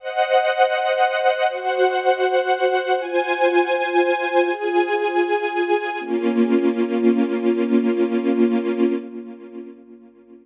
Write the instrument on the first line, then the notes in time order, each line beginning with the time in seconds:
string ensemble 1
0.00 C5 D#5 F#5
1.49 F#4 C5 F#5
3.00 F4 C5 G#5
4.49 F4 G#4 G#5
6.00 A#3 C#4 F4